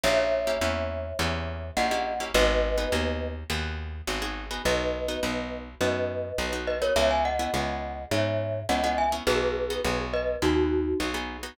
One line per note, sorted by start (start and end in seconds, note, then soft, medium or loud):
0.03 0.56 A#1 medium
0.03 0.38 A#3 medium
0.03 0.38 C#4 medium
0.03 0.38 E4 medium
0.03 0.38 G4 medium
0.03 1.69 C#5 medium
0.03 1.69 E5 loud
0.47 0.59 A#3 medium
0.47 0.59 C#4 medium
0.47 0.59 E4 medium
0.47 0.59 G4 medium
0.61 1.13 E2 medium
0.61 1.08 A#3 medium
0.61 1.08 C#4 medium
0.61 1.08 E4 medium
0.61 1.08 G4 medium
1.19 1.71 E2 medium
1.19 1.65 A#3 medium
1.19 1.65 C#4 medium
1.19 1.65 E4 medium
1.19 1.65 G4 medium
1.77 2.29 A#1 medium
1.77 1.88 A#3 medium
1.77 1.88 C#4 medium
1.77 1.88 E4 medium
1.77 1.88 G4 medium
1.77 2.24 D#5 medium
1.77 2.24 F#5 loud
1.91 2.14 A#3 medium
1.91 2.14 C#4 medium
1.91 2.14 E4 medium
1.91 2.14 G4 medium
2.20 2.32 A#3 medium
2.20 2.32 C#4 medium
2.20 2.32 E4 medium
2.20 2.32 G4 medium
2.34 2.86 G#1 loud
2.34 2.69 B3 medium
2.34 2.69 D#4 medium
2.34 2.69 F#4 medium
2.34 2.69 G#4 medium
2.34 3.28 B4 loud
2.34 3.28 D#5 loud
2.78 2.89 B3 medium
2.78 2.89 D#4 medium
2.78 2.89 F#4 medium
2.78 2.89 G#4 medium
2.92 3.44 D#2 medium
2.92 3.39 B3 medium
2.92 3.39 D#4 medium
2.92 3.39 F#4 medium
2.92 3.39 G#4 medium
3.50 4.02 D#2 medium
3.50 3.96 B3 medium
3.50 3.96 D#4 medium
3.50 3.96 F#4 medium
3.50 3.96 G#4 medium
4.07 4.59 G#1 medium
4.07 4.19 B3 medium
4.07 4.19 D#4 medium
4.07 4.19 F#4 medium
4.07 4.19 G#4 medium
4.22 4.45 B3 medium
4.22 4.45 D#4 medium
4.22 4.45 F#4 medium
4.22 4.45 G#4 medium
4.51 4.62 B3 medium
4.51 4.62 D#4 medium
4.51 4.62 F#4 medium
4.51 4.62 G#4 medium
4.65 5.17 B1 medium
4.65 5.00 B3 medium
4.65 5.00 D#4 medium
4.65 5.00 F#4 medium
4.65 5.58 B4 medium
4.65 5.58 D#5 medium
5.08 5.20 B3 medium
5.08 5.20 D#4 medium
5.08 5.20 F#4 medium
5.23 5.75 B1 medium
5.23 5.69 B3 medium
5.23 5.69 D#4 medium
5.23 5.69 F#4 medium
5.81 6.33 F#2 medium
5.81 6.27 B3 medium
5.81 6.27 D#4 medium
5.81 6.27 F#4 medium
5.81 6.53 B4 medium
5.81 6.53 D#5 medium
6.38 6.90 B1 medium
6.38 6.50 B3 medium
6.38 6.50 D#4 medium
6.38 6.50 F#4 medium
6.53 6.76 B3 medium
6.53 6.76 D#4 medium
6.53 6.76 F#4 medium
6.67 6.81 B4 medium
6.67 6.81 D#5 medium
6.82 6.93 B3 medium
6.82 6.93 D#4 medium
6.82 6.93 F#4 medium
6.82 6.95 A#4 medium
6.82 6.95 C#5 loud
6.96 7.48 C#2 medium
6.96 7.31 B3 medium
6.96 7.31 C#4 medium
6.96 7.31 E4 medium
6.96 7.31 G#4 medium
6.96 7.10 C#5 medium
6.96 7.10 E5 loud
7.10 7.24 E5 medium
7.10 7.24 G#5 medium
7.25 8.04 D#5 medium
7.25 8.04 F#5 medium
7.39 7.51 B3 medium
7.39 7.51 C#4 medium
7.39 7.51 E4 medium
7.39 7.51 G#4 medium
7.54 8.06 C#2 medium
7.54 8.00 B3 medium
7.54 8.00 C#4 medium
7.54 8.00 E4 medium
7.54 8.00 G#4 medium
8.11 8.63 G#2 medium
8.11 8.57 B3 medium
8.11 8.57 C#4 medium
8.11 8.57 E4 medium
8.11 8.57 G#4 medium
8.11 8.60 C#5 medium
8.11 8.60 E5 medium
8.69 9.21 C#2 medium
8.69 8.81 B3 medium
8.69 8.81 C#4 medium
8.69 8.81 E4 medium
8.69 8.81 G#4 medium
8.69 8.83 D#5 medium
8.69 8.83 F#5 loud
8.84 9.07 B3 medium
8.84 9.07 C#4 medium
8.84 9.07 E4 medium
8.84 9.07 G#4 medium
8.84 8.97 D#5 medium
8.84 8.97 F#5 loud
8.98 9.12 E5 medium
8.98 9.12 G#5 medium
9.12 9.24 B3 medium
9.12 9.24 C#4 medium
9.12 9.24 E4 medium
9.12 9.24 G#4 medium
9.27 9.79 B1 medium
9.27 9.62 B3 medium
9.27 9.62 D#4 medium
9.27 9.62 F#4 medium
9.27 10.00 G#4 loud
9.27 9.62 G#4 medium
9.27 10.00 B4 loud
9.70 9.82 B3 medium
9.70 9.82 D#4 medium
9.70 9.82 F#4 medium
9.70 9.82 G#4 medium
9.84 10.36 B1 medium
9.84 10.31 B3 medium
9.84 10.31 D#4 medium
9.84 10.31 F#4 medium
9.84 10.31 G#4 medium
10.13 10.37 B4 medium
10.13 10.37 D#5 loud
10.42 10.94 D#2 medium
10.42 10.88 B3 medium
10.42 10.88 D#4 medium
10.42 10.98 D#4 medium
10.42 10.88 F#4 medium
10.42 10.98 F#4 loud
10.42 10.88 G#4 medium
11.00 11.52 B1 medium
11.00 11.12 B3 medium
11.00 11.12 D#4 medium
11.00 11.12 F#4 medium
11.00 11.12 G#4 medium
11.14 11.37 B3 medium
11.14 11.37 D#4 medium
11.14 11.37 F#4 medium
11.14 11.37 G#4 medium
11.43 11.55 B3 medium
11.43 11.55 D#4 medium
11.43 11.55 F#4 medium
11.43 11.55 G#4 medium